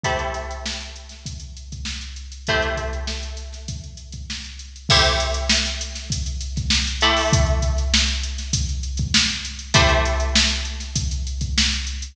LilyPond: <<
  \new Staff \with { instrumentName = "Pizzicato Strings" } { \time 4/4 \key a \dorian \tempo 4 = 99 <a e' g' c''>1 | <a e' g' c''>1 | <a e' g' c''>2.~ <a e' g' c''>8 <a e' g' c''>8~ | <a e' g' c''>1 |
<a e' g' c''>1 | }
  \new DrumStaff \with { instrumentName = "Drums" } \drummode { \time 4/4 <hh bd>16 hh16 <hh sn>16 hh16 sn16 hh16 hh16 <hh sn>16 <hh bd>16 hh16 hh16 <hh bd>16 sn16 <hh sn>16 hh16 hh16 | <hh bd>16 <hh sn>16 <hh bd>16 hh16 sn16 hh16 <hh sn>16 <hh sn>16 <hh bd>16 hh16 hh16 <hh bd>16 sn16 hh16 hh16 hh16 | <cymc bd>16 <hh sn>16 hh16 hh16 sn16 hh16 hh16 <hh sn>16 <hh bd>16 hh16 hh16 <hh bd sn>16 sn16 hh16 hh16 hho16 | <hh bd>16 hh16 <hh bd>16 <hh sn>16 sn16 hh16 hh16 <hh sn>16 <hh bd>16 hh16 hh16 <hh bd>16 sn16 hh16 hh16 hh16 |
<hh bd>16 hh16 <hh sn>16 hh16 sn16 hh16 hh16 <hh sn>16 <hh bd>16 hh16 hh16 <hh bd>16 sn16 <hh sn>16 hh16 hh16 | }
>>